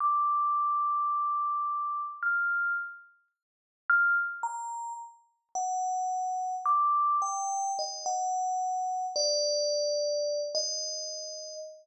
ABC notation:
X:1
M:7/8
L:1/16
Q:1/4=54
K:none
V:1 name="Tubular Bells"
d'8 f'2 z4 | f' z ^a2 z2 ^f4 d'2 g2 | ^d ^f4 =d5 ^d4 |]